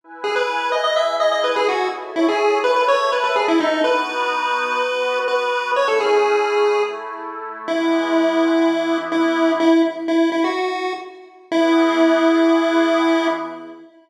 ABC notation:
X:1
M:4/4
L:1/16
Q:1/4=125
K:E
V:1 name="Lead 1 (square)"
z2 G B3 d d e2 d d B G F2 | z2 E G3 B B c2 B B G E D2 | B12 B4 | c A G8 z6 |
E12 E4 | E2 z2 E2 E F5 z4 | E16 |]
V:2 name="Pad 5 (bowed)"
[EBg]8 [EGg]8 | [Ace]8 [Aea]8 | [B,DF]8 [B,FB]8 | [A,CE]8 [A,EA]8 |
[E,G,B,]8 [E,B,E]8 | z16 | [E,B,G]16 |]